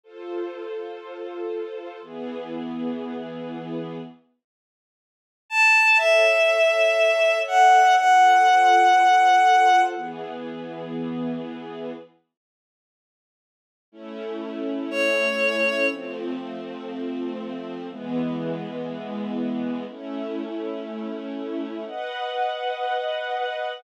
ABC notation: X:1
M:4/4
L:1/8
Q:1/4=121
K:A
V:1 name="Violin"
z8 | z8 | z6 a2 | e6 f2 |
f8 | z8 | z8 | z4 c4 |
z8 | z8 | z8 | [K:B] z8 |]
V:2 name="String Ensemble 1"
[=FA=c]8 | [E,B,G]8 | z8 | [Ace]8 |
[=FA=c]8 | [E,B,G]8 | z8 | [A,CE]8 |
[=F,A,=C]8 | [E,G,B,]8 | [A,CE]8 | [K:B] [Bdf]8 |]